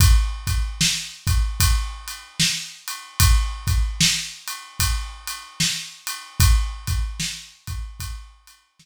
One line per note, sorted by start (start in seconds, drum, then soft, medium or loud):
0.00 kick loud
0.00 ride medium
0.47 kick medium
0.47 ride medium
0.81 snare loud
1.27 kick medium
1.27 ride medium
1.60 kick medium
1.60 ride medium
2.08 ride medium
2.40 snare loud
2.88 ride medium
3.20 kick medium
3.20 ride loud
3.67 kick medium
3.67 ride medium
4.00 snare loud
4.48 ride medium
4.79 kick medium
4.79 ride medium
5.28 ride medium
5.60 snare medium
6.07 ride medium
6.40 kick medium
6.40 ride medium
6.87 kick medium
6.87 ride medium
7.20 snare medium
7.67 kick medium
7.67 ride medium
8.00 kick medium
8.00 ride medium
8.47 ride medium
8.79 snare medium